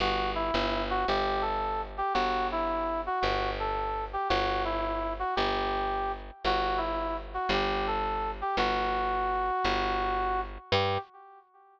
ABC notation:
X:1
M:4/4
L:1/8
Q:"Swing" 1/4=112
K:G
V:1 name="Brass Section"
F E2 F G A2 G | F E2 F F A2 G | F E2 F G3 z | F E2 F G A2 G |
F7 z | G2 z6 |]
V:2 name="Electric Bass (finger)" clef=bass
G,,,2 G,,,2 G,,,4 | G,,,4 G,,,4 | G,,,4 G,,,4 | G,,,4 G,,,4 |
G,,,4 G,,,4 | G,,2 z6 |]